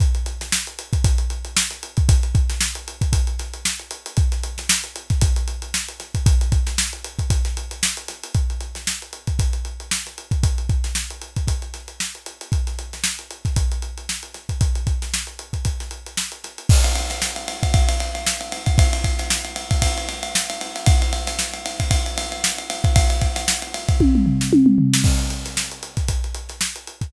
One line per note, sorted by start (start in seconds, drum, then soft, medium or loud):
0.00 kick loud
0.00 closed hi-hat medium
0.15 closed hi-hat medium
0.26 closed hi-hat medium
0.41 snare medium
0.41 closed hi-hat medium
0.52 snare loud
0.67 closed hi-hat medium
0.79 closed hi-hat medium
0.93 kick medium
0.93 closed hi-hat medium
1.04 kick loud
1.04 closed hi-hat loud
1.18 closed hi-hat medium
1.30 closed hi-hat medium
1.45 closed hi-hat medium
1.57 snare loud
1.71 snare soft
1.71 closed hi-hat medium
1.83 closed hi-hat medium
1.97 kick loud
1.97 closed hi-hat medium
2.09 kick loud
2.09 closed hi-hat loud
2.23 closed hi-hat medium
2.35 kick loud
2.35 closed hi-hat medium
2.50 snare medium
2.50 closed hi-hat medium
2.61 snare loud
2.75 closed hi-hat medium
2.88 closed hi-hat medium
3.01 kick medium
3.01 closed hi-hat medium
3.13 kick medium
3.13 closed hi-hat loud
3.27 closed hi-hat medium
3.39 snare soft
3.39 closed hi-hat medium
3.53 closed hi-hat medium
3.65 snare loud
3.79 closed hi-hat medium
3.91 closed hi-hat medium
4.06 closed hi-hat medium
4.17 kick loud
4.17 closed hi-hat medium
4.32 snare soft
4.32 closed hi-hat medium
4.43 closed hi-hat medium
4.58 snare medium
4.58 closed hi-hat medium
4.69 snare loud
4.84 closed hi-hat medium
4.96 closed hi-hat medium
5.10 kick medium
5.10 snare soft
5.10 closed hi-hat medium
5.21 kick loud
5.21 closed hi-hat loud
5.36 closed hi-hat medium
5.48 closed hi-hat medium
5.62 closed hi-hat medium
5.74 snare loud
5.88 closed hi-hat medium
6.00 snare soft
6.00 closed hi-hat medium
6.15 kick medium
6.15 closed hi-hat medium
6.26 kick loud
6.26 closed hi-hat loud
6.41 closed hi-hat medium
6.52 kick medium
6.52 closed hi-hat medium
6.67 snare medium
6.67 closed hi-hat medium
6.78 snare loud
6.93 closed hi-hat medium
7.04 closed hi-hat medium
7.19 kick medium
7.19 closed hi-hat medium
7.30 kick medium
7.30 closed hi-hat loud
7.45 snare soft
7.45 closed hi-hat medium
7.57 closed hi-hat medium
7.71 closed hi-hat medium
7.83 snare loud
7.97 closed hi-hat medium
8.08 snare soft
8.08 closed hi-hat medium
8.23 closed hi-hat medium
8.34 kick medium
8.34 closed hi-hat medium
8.50 closed hi-hat medium
8.61 closed hi-hat medium
8.75 snare medium
8.75 closed hi-hat medium
8.87 snare loud
9.02 closed hi-hat medium
9.13 closed hi-hat medium
9.27 kick medium
9.27 closed hi-hat medium
9.39 kick medium
9.39 closed hi-hat loud
9.53 closed hi-hat medium
9.65 closed hi-hat medium
9.80 closed hi-hat medium
9.91 snare loud
10.06 snare soft
10.06 closed hi-hat medium
10.18 closed hi-hat medium
10.31 kick medium
10.31 closed hi-hat medium
10.43 kick loud
10.43 closed hi-hat loud
10.58 closed hi-hat medium
10.69 kick medium
10.69 closed hi-hat medium
10.84 snare medium
10.84 closed hi-hat medium
10.95 snare loud
11.10 closed hi-hat medium
11.22 closed hi-hat medium
11.36 kick medium
11.36 closed hi-hat medium
11.47 kick medium
11.47 closed hi-hat medium
11.62 closed hi-hat medium
11.74 snare soft
11.74 closed hi-hat medium
11.88 closed hi-hat medium
12.00 snare medium
12.15 closed hi-hat medium
12.26 closed hi-hat medium
12.41 closed hi-hat medium
12.52 kick medium
12.52 closed hi-hat medium
12.67 snare soft
12.67 closed hi-hat medium
12.79 closed hi-hat medium
12.93 snare medium
12.93 closed hi-hat medium
13.04 snare loud
13.19 closed hi-hat medium
13.31 closed hi-hat medium
13.45 kick medium
13.45 snare soft
13.45 closed hi-hat medium
13.56 kick medium
13.56 closed hi-hat loud
13.72 closed hi-hat medium
13.82 closed hi-hat medium
13.97 closed hi-hat medium
14.09 snare medium
14.23 closed hi-hat medium
14.34 snare soft
14.34 closed hi-hat medium
14.49 kick medium
14.49 closed hi-hat medium
14.61 kick loud
14.61 closed hi-hat medium
14.75 closed hi-hat medium
14.87 kick medium
14.87 closed hi-hat medium
15.02 snare medium
15.02 closed hi-hat medium
15.14 snare loud
15.27 closed hi-hat medium
15.39 closed hi-hat medium
15.53 kick medium
15.53 closed hi-hat medium
15.65 kick medium
15.65 closed hi-hat medium
15.80 snare soft
15.80 closed hi-hat medium
15.91 closed hi-hat medium
16.06 closed hi-hat medium
16.17 snare loud
16.32 closed hi-hat medium
16.44 snare soft
16.44 closed hi-hat medium
16.58 closed hi-hat medium
16.69 kick loud
16.69 crash loud
16.84 ride medium
16.95 ride medium
17.10 snare medium
17.10 ride medium
17.22 snare loud
17.36 ride medium
17.48 ride medium
17.63 kick medium
17.63 ride medium
17.74 kick loud
17.74 ride loud
17.89 ride medium
18.00 snare soft
18.00 ride medium
18.15 ride medium
18.27 snare loud
18.41 ride medium
18.52 ride medium
18.66 kick medium
18.66 snare soft
18.66 ride medium
18.78 kick loud
18.78 ride loud
18.93 ride medium
19.04 kick medium
19.04 ride medium
19.19 snare medium
19.19 ride medium
19.30 snare loud
19.45 snare soft
19.45 ride medium
19.56 ride medium
19.71 kick medium
19.71 ride medium
19.82 kick medium
19.82 ride loud
19.98 ride medium
20.09 ride medium
20.23 ride medium
20.35 snare loud
20.50 snare soft
20.50 ride medium
20.61 ride medium
20.75 snare soft
20.75 ride medium
20.86 kick loud
20.86 ride loud
21.02 ride medium
21.13 ride medium
21.27 snare medium
21.27 ride medium
21.39 snare loud
21.53 snare soft
21.53 ride medium
21.66 ride medium
21.80 kick medium
21.80 ride medium
21.91 kick medium
21.91 ride loud
22.06 ride medium
22.18 ride loud
22.32 ride medium
22.44 snare loud
22.58 ride medium
22.70 snare soft
22.70 ride medium
22.84 kick loud
22.84 ride medium
22.96 kick loud
22.96 ride loud
23.10 ride medium
23.22 kick medium
23.22 ride medium
23.36 snare medium
23.36 ride medium
23.48 snare loud
23.62 ride medium
23.74 ride medium
23.88 kick loud
23.88 ride medium
24.00 kick medium
24.00 high tom medium
24.15 mid tom medium
24.26 floor tom medium
24.41 snare medium
24.53 high tom loud
24.66 mid tom medium
24.78 floor tom loud
24.93 snare loud
25.04 kick loud
25.04 crash loud
25.19 closed hi-hat medium
25.30 closed hi-hat medium
25.45 snare medium
25.45 closed hi-hat medium
25.57 snare loud
25.71 closed hi-hat medium
25.83 closed hi-hat medium
25.97 kick medium
25.97 snare soft
25.97 closed hi-hat medium
26.08 kick medium
26.08 closed hi-hat loud
26.24 closed hi-hat medium
26.34 closed hi-hat medium
26.49 snare soft
26.49 closed hi-hat medium
26.61 snare loud
26.76 closed hi-hat medium
26.87 closed hi-hat medium
27.01 kick medium
27.01 snare soft
27.01 closed hi-hat medium